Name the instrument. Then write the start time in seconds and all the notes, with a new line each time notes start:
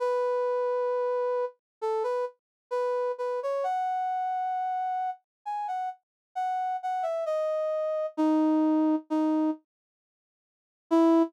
brass section
0.00 B4
1.81 A4
2.03 B4
2.71 B4
3.18 B4
3.43 C#5
3.64 F#5
5.45 G#5
5.68 F#5
6.35 F#5
6.83 F#5
7.03 E5
7.26 D#5
8.17 D#4
9.10 D#4
10.91 E4